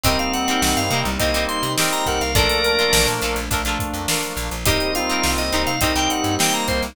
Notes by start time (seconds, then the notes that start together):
0.03 C2 G3 A#3 C4 D#4 G4 A#4 D#5, kick, closed hi-hat
0.19 F5, closed hi-hat
0.33 F#5, snare, closed hi-hat
0.48 C4 D#4 G4 A#4, closed hi-hat
0.62 C2 F#5, snare
0.77 G2 F5, snare, closed hi-hat
0.90 C3 A#3 C4 D#4 G4 A#4, closed hi-hat
1.05 C2 G3, closed hi-hat
1.19 C2 G3 A#3 C4 D#4 G4 A#4 D#5, kick, closed hi-hat
1.34 C2 C4 D#4 G4 A#4, closed hi-hat
1.49 C6, closed hi-hat
1.63 C3, closed hi-hat
1.78 C4 D#4 G4 A#4, snare
1.91 A#5, snare, closed hi-hat
2.06 C2 A#4 F#5, kick, closed hi-hat
2.21 C2 F5, snare, closed hi-hat
2.35 A#1 F3 A3 A#3 D4 F4 A4 A#4 D5, kick, closed hi-hat
2.49 snare, closed hi-hat
2.64 A#4, closed hi-hat
2.79 D4 F4 A4 A#4, closed hi-hat
2.93 A#1, snare
3.07 A#2, closed hi-hat
3.22 A#1 D4 F4 A4 A#4, closed hi-hat
3.36 A#1, closed hi-hat
3.50 A#1 F3 A3 A#3 D4 F4 A4 A#4, kick, closed hi-hat
3.65 A#1 D4 F4 A4 A#4, closed hi-hat
3.79 kick, closed hi-hat
3.94 F2, closed hi-hat
4.08 D4 F4 A4 A#4, snare
4.23 closed hi-hat
4.37 A#1, snare, closed hi-hat
4.51 A#1, closed hi-hat
4.66 C2 G3 A#3 C4 D#4 G4 A#4 D#5, kick, closed hi-hat
4.80 closed hi-hat
4.95 F4 F5, closed hi-hat
5.09 C4 D#4 G4 A#4, closed hi-hat
5.23 C2, snare
5.38 C2 D#5, closed hi-hat
5.52 C2 C4 D#4 G4 A#4, closed hi-hat
5.67 C3 F5, closed hi-hat
5.81 C2 G3 A#3 C4 D#4 G4 A#4 D#5, kick, closed hi-hat
5.95 C2 C4 D#4 G4 A#4 G5, closed hi-hat
6.10 F#5, closed hi-hat
6.24 G2, closed hi-hat
6.39 A#3 C4 D#4 G4 A#4 G5, snare
6.53 A#5, closed hi-hat
6.68 C2 C5, kick, closed hi-hat
6.83 C2, snare, closed hi-hat